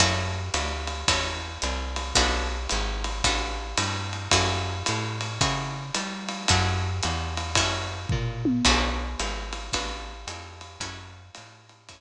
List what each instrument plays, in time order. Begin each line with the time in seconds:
0.00 electric bass (finger) F#2, acoustic guitar (steel) C#4 E4 F#4 A4, kick, ride
0.54 electric bass (finger) D2, hi-hat pedal, ride
0.87 ride
1.08 electric bass (finger) E2, acoustic guitar (steel) C#4 E4 F#4 A4, kick, ride
1.62 electric bass (finger) C2, hi-hat pedal, ride
1.96 ride
2.15 electric bass (finger) B1, acoustic guitar (steel) B3 D4 F#4 A4, kick, ride
2.69 electric bass (finger) G#1, hi-hat pedal, ride
3.04 ride
3.24 electric bass (finger) A1, acoustic guitar (steel) B3 D4 F#4 A4, kick, ride
3.77 electric bass (finger) G2, hi-hat pedal, ride
4.13 ride
4.31 electric bass (finger) F#2, acoustic guitar (steel) C#4 E4 F#4 A4, kick, ride
4.86 electric bass (finger) A2, hi-hat pedal, ride
5.21 ride
5.41 electric bass (finger) C#3, acoustic guitar (steel) C#4 E4 F#4 A4, kick, ride
5.94 electric bass (finger) G3, hi-hat pedal, ride
6.28 ride
6.48 electric bass (finger) F#2, acoustic guitar (steel) C#4 E4 F#4 A4, kick, ride
7.03 electric bass (finger) E2, hi-hat pedal, ride
7.37 ride
7.55 electric bass (finger) F#2, acoustic guitar (steel) C#4 E4 F#4 A4, kick, ride
8.09 electric bass (finger) A#2, kick, floor tom
8.45 high tom
8.65 electric bass (finger) B1, acoustic guitar (steel) B3 D4 F#4 A4, kick, crash, ride
9.19 electric bass (finger) G#1, hi-hat pedal, ride
9.53 ride
9.73 electric bass (finger) A1, acoustic guitar (steel) B3 D4 F#4 A4, kick, ride
10.27 electric bass (finger) F2, hi-hat pedal, ride
10.61 ride
10.80 electric bass (finger) F#2, acoustic guitar (steel) C#4 E4 F#4 A4, kick, ride
11.35 electric bass (finger) A2, hi-hat pedal, ride
11.69 ride
11.89 electric bass (finger) F#2, acoustic guitar (steel) C#4 E4 F#4 A4, kick, ride